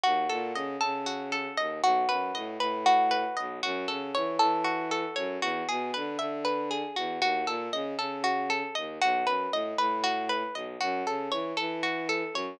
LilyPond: <<
  \new Staff \with { instrumentName = "Pizzicato Strings" } { \time 7/8 \key e \major \tempo 4 = 117 fis'8 a'8 dis''8 a'8 fis'8 a'8 dis''8 | fis'8 b'8 dis''8 b'8 fis'8 b'8 dis''8 | fis'8 a'8 cis''8 a'8 fis'8 a'8 cis''8 | fis'8 gis'8 b'8 e''8 b'8 gis'8 fis'8 |
fis'8 a'8 dis''8 a'8 fis'8 a'8 dis''8 | fis'8 b'8 dis''8 b'8 fis'8 b'8 dis''8 | fis'8 a'8 cis''8 a'8 fis'8 a'8 cis''8 | }
  \new Staff \with { instrumentName = "Violin" } { \clef bass \time 7/8 \key e \major dis,8 ais,8 cis8 cis4. dis,8 | b,,8 fis,8 a,8 a,4. b,,8 | fis,8 cis8 e8 e4. fis,8 | e,8 b,8 d8 d4. e,8 |
dis,8 ais,8 cis8 cis4. dis,8 | b,,8 fis,8 a,8 a,4. b,,8 | fis,8 cis8 e8 e4. fis,8 | }
>>